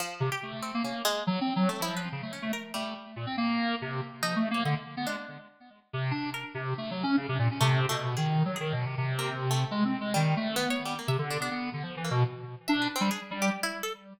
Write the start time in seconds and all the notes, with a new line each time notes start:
0.00 F3
0.20 C3
0.32 G4
0.43 A3
0.62 C4
0.74 A#3
0.83 A#3 C#4
1.05 G#3
1.27 F#3
1.41 C4
1.56 F#3
1.69 A3
1.80 F3 E4
1.97 B4
2.12 C#3
2.22 A3
2.33 C#4
2.42 A3
2.53 A#4
2.74 G3 A3
3.16 A#2
3.26 C4
3.37 A#3
3.82 C3
4.22 F3 D#4
4.36 A3
4.51 A#3 C#5
4.65 D3 D#5
4.97 B3
5.07 G#3 D4
5.93 C3
6.11 D4
6.34 A#4
6.54 C3
6.78 A3
6.91 F#3
7.03 C#4
7.17 C#3
7.29 C3
7.39 A#2
7.51 C#4
7.61 C3 A3
7.89 B2 A3
8.17 D#3 G#4
8.45 F#3
8.56 G#4
8.60 D#3
8.72 B2
8.86 C3
8.98 C3
9.19 A#3
9.51 A3
9.71 G#3
9.85 C4
10.01 G#3
10.14 D#3 G3
10.37 A3
10.56 B3
10.70 C#5
10.85 G3
10.99 A#3
11.08 C3 E5
11.18 D3
11.30 D4
11.40 B3 D4
11.51 B3
11.73 D3
11.83 F3
11.97 E3
12.04 A#3
12.11 B2
12.68 D4 E5
12.82 B4
12.96 C4
13.01 G3
13.11 G#4
13.31 G3
13.42 G4
13.63 E4
13.83 A4